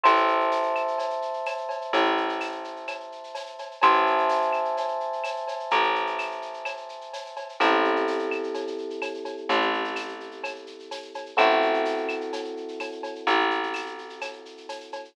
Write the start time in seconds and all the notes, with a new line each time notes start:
0.04 A1 C5 E5 A5, cowbell, claves, shaker
0.16 shaker
0.28 shaker
0.40 shaker
0.51 tambourine, shaker
0.63 shaker
0.76 claves, shaker
0.88 shaker
0.98 cowbell, shaker
1.10 shaker
1.22 shaker
1.34 shaker
1.46 tambourine, cowbell, claves, shaker
1.58 shaker
1.69 cowbell, shaker
1.81 shaker
1.93 A1, cowbell, shaker
2.05 shaker
2.17 shaker
2.29 shaker
2.41 tambourine, claves, shaker
2.52 shaker
2.64 shaker
2.76 shaker
2.87 cowbell, claves, shaker
3.00 shaker
3.12 shaker
3.24 shaker
3.35 tambourine, cowbell, shaker
3.46 shaker
3.59 cowbell, shaker
3.71 shaker
3.82 A1 C5 E5 G#5 A5, cowbell, claves, shaker
3.94 shaker
4.06 shaker
4.18 shaker
4.29 tambourine, shaker
4.41 shaker
4.53 claves, shaker
4.65 shaker
4.77 cowbell, shaker
4.88 shaker
5.00 shaker
5.13 shaker
5.24 tambourine, cowbell, claves, shaker
5.36 shaker
5.48 cowbell, shaker
5.60 shaker
5.71 A1, cowbell, shaker
5.83 shaker
5.95 shaker
6.07 shaker
6.19 tambourine, claves, shaker
6.31 shaker
6.42 shaker
6.54 shaker
6.65 cowbell, claves, shaker
6.77 shaker
6.89 shaker
7.01 shaker
7.13 tambourine, cowbell, shaker
7.26 shaker
7.37 cowbell, shaker
7.49 shaker
7.60 A1 C4 E4 G4 A4, cowbell, claves, shaker
7.72 shaker
7.84 shaker
7.96 shaker
8.07 tambourine, shaker
8.19 shaker
8.31 claves, shaker
8.43 shaker
8.54 cowbell, shaker
8.67 shaker
8.78 shaker
8.90 shaker
9.02 tambourine, cowbell, claves, shaker
9.14 shaker
9.25 cowbell, shaker
9.37 shaker
9.49 A1, cowbell, shaker
9.61 shaker
9.73 shaker
9.84 shaker
9.96 tambourine, claves, shaker
10.08 shaker
10.20 shaker
10.31 shaker
10.44 cowbell, claves, shaker
10.56 shaker
10.67 shaker
10.79 shaker
10.91 tambourine, cowbell, shaker
11.02 shaker
11.14 cowbell, shaker
11.26 shaker
11.37 A1 C4 E4 F#4 A4, cowbell, claves, shaker
11.50 shaker
11.62 shaker
11.74 shaker
11.85 tambourine, shaker
11.97 shaker
12.09 claves, shaker
12.21 shaker
12.33 cowbell, shaker
12.44 shaker
12.57 shaker
12.68 shaker
12.80 tambourine, cowbell, claves, shaker
12.92 shaker
13.03 cowbell, shaker
13.15 shaker
13.27 A1, cowbell, shaker
13.39 shaker
13.50 shaker
13.63 shaker
13.74 tambourine, claves, shaker
13.86 shaker
13.98 shaker
14.09 shaker
14.21 cowbell, claves, shaker
14.33 shaker
14.45 shaker
14.57 shaker
14.69 tambourine, cowbell, shaker
14.80 shaker
14.92 cowbell, shaker
15.05 shaker